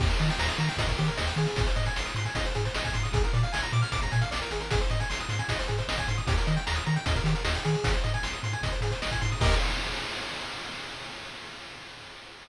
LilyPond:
<<
  \new Staff \with { instrumentName = "Lead 1 (square)" } { \time 4/4 \key ees \major \tempo 4 = 153 g'16 bes'16 ees''16 g''16 bes''16 ees'''16 bes''16 g''16 ees''16 bes'16 g'16 bes'16 ees''16 g''16 aes'8~ | aes'16 c''16 ees''16 aes''16 c'''16 ees'''16 c'''16 aes''16 ees''16 c''16 aes'16 c''16 ees''16 aes''16 c'''16 ees'''16 | aes'16 bes'16 d''16 f''16 aes''16 bes''16 d'''16 f'''16 d'''16 bes''16 aes''16 f''16 d''16 bes'16 aes'16 bes'16 | aes'16 c''16 ees''16 aes''16 c'''16 ees'''16 c'''16 aes''16 ees''16 c''16 aes'16 c''16 ees''16 aes''16 c'''16 ees'''16 |
g'16 bes'16 ees''16 g''16 bes''16 ees'''16 bes''16 g''16 ees''16 bes'16 g'16 bes'16 ees''16 g''16 aes'8~ | aes'16 c''16 ees''16 aes''16 c'''16 ees'''16 c'''16 aes''16 ees''16 c''16 aes'16 c''16 ees''16 aes''16 c'''16 ees'''16 | <g' bes' ees''>4 r2. | }
  \new Staff \with { instrumentName = "Synth Bass 1" } { \clef bass \time 4/4 \key ees \major ees,8 ees8 ees,8 ees8 ees,8 ees8 ees,8 ees8 | aes,,8 aes,8 aes,,8 aes,8 aes,,8 aes,8 aes,,8 aes,8 | bes,,8 bes,8 bes,,8 bes,8 bes,,8 bes,8 bes,,8 aes,,8~ | aes,,8 aes,8 aes,,8 aes,8 aes,,8 aes,8 aes,,8 aes,8 |
ees,8 ees8 ees,8 ees8 ees,8 ees8 ees,8 ees8 | aes,,8 aes,8 aes,,8 aes,8 aes,,8 aes,8 aes,,8 aes,8 | ees,4 r2. | }
  \new DrumStaff \with { instrumentName = "Drums" } \drummode { \time 4/4 <cymc bd>16 hh16 hh16 hh16 sn16 hh16 hh16 hh16 <hh bd>16 <hh bd>16 <hh sn>16 hh16 sn16 hh16 hh16 hh16 | <hh bd>16 hh16 hh16 hh16 sn16 hh16 hh16 hh16 <hh bd>16 hh16 <hh sn>16 hh16 sn16 <hh bd>16 hh16 hh16 | <hh bd>16 hh16 hh16 hh16 sn16 hh16 hh16 hh16 <hh bd>16 <hh bd>16 <hh sn>16 hh16 sn16 hh16 hh16 hh16 | <hh bd>16 hh16 hh16 hh16 sn16 hh16 hh16 hh16 <hh bd>16 hh16 <hh sn>16 hh16 sn16 <hh bd>16 hh16 hh16 |
<hh bd>16 hh16 hh16 hh16 sn16 hh16 hh16 hh16 <hh bd>16 <hh bd>16 <hh sn>16 hh16 sn16 hh16 hh16 hh16 | <hh bd>16 hh16 hh16 hh16 sn16 hh16 hh16 hh16 <hh bd>16 hh16 <hh sn>16 hh16 sn16 <hh bd>16 hh16 hho16 | <cymc bd>4 r4 r4 r4 | }
>>